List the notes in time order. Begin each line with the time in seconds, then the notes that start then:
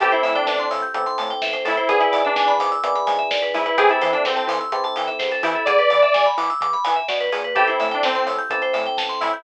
0.00 A1 C4 E4 G4 A4, kick, closed hi-hat
0.12 E4 C5, closed hi-hat
0.23 A2 E5, open hi-hat
0.35 D4 G5, closed hi-hat
0.46 A1 D4 A5, kick, snare
0.59 C6, closed hi-hat
0.71 A2 E6, open hi-hat
0.82 G6, closed hi-hat
0.94 A1 C4 E4 G4 A4 E6, kick, closed hi-hat
1.06 C6, closed hi-hat
1.18 A2 A5, open hi-hat
1.30 G5, closed hi-hat
1.42 A1 E5, kick, snare
1.53 C5, closed hi-hat
1.65 A2 E4 A4, open hi-hat
1.77 C5, closed hi-hat
1.88 G#1 B3 D4 E4 G#4, kick, closed hi-hat
1.99 E4 B4, closed hi-hat
2.12 G#2 D5, open hi-hat
2.25 D4 E5, closed hi-hat
2.35 G#1 D4 G#5, kick, snare
2.48 B5, closed hi-hat
2.60 G#2 D6, open hi-hat
2.71 E6, closed hi-hat
2.83 G#1 B3 D4 E4 G#4 D6, kick, closed hi-hat
2.95 B5, closed hi-hat
3.07 G#2 G#5, open hi-hat
3.19 E5, closed hi-hat
3.30 G#1 D5, kick, snare
3.42 B4, closed hi-hat
3.54 G#2 E4 G#4, open hi-hat
3.66 B4, closed hi-hat
3.77 E2 C4 E4 G4 G#4 A4, kick, closed hi-hat
3.89 E4 A4, closed hi-hat
4.01 E3 C5, open hi-hat
4.13 D4 E5, closed hi-hat
4.25 E2 C4 G5, kick, snare
4.36 A5, closed hi-hat
4.47 E3 C6, open hi-hat
4.61 E6, closed hi-hat
4.72 E2 C4 E4 G4 A4 C6, kick, closed hi-hat
4.84 A5, closed hi-hat
4.96 E3 G5, open hi-hat
5.07 E5, closed hi-hat
5.19 E2 C5, kick, snare
5.31 A4, closed hi-hat
5.43 E3 E4 G4, open hi-hat
5.55 A4, closed hi-hat
5.65 E2 G#4 D5, kick, closed hi-hat
5.79 B4, closed hi-hat
5.90 E3 D5, open hi-hat
6.02 E5, closed hi-hat
6.14 E2 G#5, kick, snare
6.26 B5, closed hi-hat
6.37 E3 D6, open hi-hat
6.50 E6, closed hi-hat
6.61 E2 D6, kick, closed hi-hat
6.73 B5, closed hi-hat
6.84 E3 G#5, open hi-hat
6.96 E5, closed hi-hat
7.08 B2 D5, kick, snare
7.20 B4, closed hi-hat
7.32 A#2 G#4, open hi-hat
7.44 B4, closed hi-hat
7.55 A1 C4 E4 G4 A4, kick, closed hi-hat
7.67 E4 C5, closed hi-hat
7.80 A2 E5, open hi-hat
7.91 D4 G5, closed hi-hat
8.03 A1 C4 A5, kick, snare
8.15 C6, closed hi-hat
8.26 A2 E6, open hi-hat
8.38 G6, closed hi-hat
8.50 A1 C4 E4 G4 A4, kick, closed hi-hat
8.62 C5, closed hi-hat
8.73 A2 E5, open hi-hat
8.85 G5, closed hi-hat
8.97 A1 A5, kick, snare
9.09 C6, closed hi-hat
9.21 A2 E4 E6, open hi-hat
9.33 G6, closed hi-hat